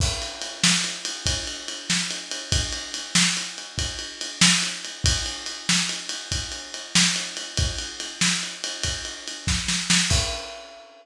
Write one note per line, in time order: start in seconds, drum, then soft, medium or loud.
0.00 kick loud
0.00 crash loud
0.22 ride medium
0.42 ride medium
0.64 snare loud
0.84 ride medium
1.05 ride medium
1.26 kick medium
1.26 ride loud
1.47 ride medium
1.68 ride medium
1.90 snare medium
2.11 ride medium
2.31 ride medium
2.52 kick loud
2.52 ride loud
2.73 ride medium
2.94 ride medium
3.15 snare loud
3.37 ride medium
3.58 ride medium
3.78 kick medium
3.78 ride medium
3.99 ride medium
4.21 ride medium
4.41 snare loud
4.62 ride medium
4.85 ride medium
5.04 kick loud
5.04 ride loud
5.26 ride medium
5.46 ride medium
5.69 snare loud
5.89 ride medium
6.09 ride medium
6.32 kick medium
6.32 ride medium
6.52 ride medium
6.74 ride medium
6.95 snare loud
7.16 ride medium
7.37 ride medium
7.57 kick loud
7.57 ride loud
7.79 ride medium
8.00 ride medium
8.21 snare loud
8.43 ride medium
8.64 ride medium
8.84 kick medium
8.84 ride loud
9.05 ride medium
9.28 ride medium
9.47 kick medium
9.47 snare medium
9.68 snare medium
9.90 snare loud
10.10 kick loud
10.10 crash loud